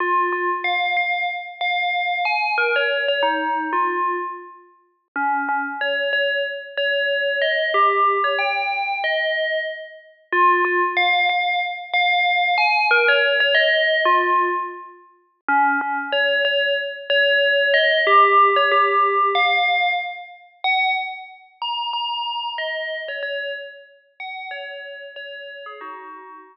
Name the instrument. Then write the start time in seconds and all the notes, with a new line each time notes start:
tubular bells
0.00 F4
0.33 F4
0.64 F5
0.97 F5
1.61 F5
2.25 G#5
2.58 A#4
2.76 C#5
3.08 C#5
3.23 D#4
3.73 F4
5.16 C#4
5.49 C#4
5.81 C#5
6.13 C#5
6.77 C#5
7.42 D#5
7.74 G4
8.24 C#5
8.39 G5
9.04 D#5
10.33 F4
10.65 F4
10.97 F5
11.29 F5
11.94 F5
12.58 G#5
12.91 A#4
13.08 C#5
13.40 C#5
13.55 D#5
14.05 F4
15.48 C#4
15.81 C#4
16.12 C#5
16.45 C#5
17.10 C#5
17.74 D#5
18.07 G4
18.56 C#5
18.72 G4
19.35 F5
20.64 F#5
21.62 A#5
21.93 A#5
22.58 D#5
23.08 C#5
23.23 C#5
24.20 F#5
24.51 C#5
25.16 C#5
25.66 G#4
25.81 D#4 F#4